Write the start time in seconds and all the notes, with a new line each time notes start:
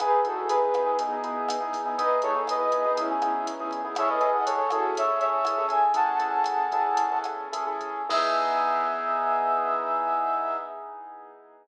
0.00 E2 B3 D#4 E4 G#4 B4, kick, cross-stick, closed hi-hat
0.25 B3 D#4 E4 F#4 G#4 A4, closed hi-hat
0.37 B3 D#4 E4 G#4
0.49 B2 G#4 B4, closed hi-hat
0.74 B3 D#4 E4 G#4, kick, cross-stick, closed hi-hat
0.86 B3 D#4 E4 G#4
0.99 B2 B3 D#4 E4 G#4, kick, closed hi-hat
1.13 B3 D#4 E4 G#4
1.24 B3 D#4 E4 G#4, closed hi-hat
1.49 E2, cross-stick, closed hi-hat
1.60 B3 D#4 E4 G#4
1.73 kick, open hi-hat
1.86 B3 D#4 E4 G#4
1.98 E2 B3 D#4 E4 G#4 B4 D#5, kick, closed hi-hat
2.22 B3 D#4 E4 G#4 A4 C#5, closed hi-hat
2.35 B3 D#4 E4 G#4
2.47 B2 B4 D#5, cross-stick, closed hi-hat
2.72 B3 D#4 E4 G#4, kick, closed hi-hat
2.86 B3 D#4 E4 G#4
2.97 B2 B3 C#4 D#4 E4 G#4, kick, closed hi-hat
3.11 B3 D#4 E4 G#4
3.22 B3 D#4 E4 G#4, cross-stick, closed hi-hat
3.47 E2, closed hi-hat
3.60 B3 D#4 E4 G#4
3.71 E2, kick, closed hi-hat
3.85 B3 D#4 E4 G#4
3.95 C#4 E4 G#4 A4 C#5 E5, kick, cross-stick, closed hi-hat
4.10 B4 D#5
4.21 C#4 E4 G#4 A4, closed hi-hat
4.33 D#5 F#5
4.46 E2 A4 C#5, closed hi-hat
4.70 C#4 E4 F#4 G#4 A4, kick, cross-stick, closed hi-hat
4.95 E2 C#5 E5, kick, closed hi-hat
5.08 C#4 E4 G#4 A4
5.20 C#5 E5, closed hi-hat
5.45 E2 C#4 E4 G#4 A4, cross-stick, closed hi-hat
5.58 C#4 E4 G#4 A4
5.69 E5 G#5, kick, closed hi-hat
5.94 A1 C#4 E4 G#4 A4 F#5 A5, kick, closed hi-hat
6.19 C#4 E4 G#4 A4 F#5 A5, closed hi-hat
6.44 A1, cross-stick, closed hi-hat
6.72 C#4 E4 G#4 A4, kick, closed hi-hat
6.97 E2, kick, closed hi-hat
7.12 C#4 E4 G#4 A4
7.24 cross-stick, closed hi-hat
7.53 A1 C#4 E4 G#4 A4, closed hi-hat
7.67 C#4 E4 G#4 A4
7.81 kick, closed hi-hat
8.09 E2 B3 D#4 E4 G#4 E5, kick, crash